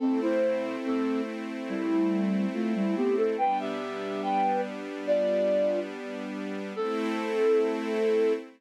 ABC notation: X:1
M:2/4
L:1/16
Q:1/4=71
K:Am
V:1 name="Flute"
[CA] [Ec]3 [CA]2 z2 | [G,E]4 [A,F] [G,E] [B,G] [CA] | [Bg] [Ge]3 [Bg]2 z2 | [Fd]4 z4 |
A8 |]
V:2 name="String Ensemble 1"
[A,CE]8- | [A,CE]8 | [G,B,D]8- | [G,B,D]8 |
[A,CE]8 |]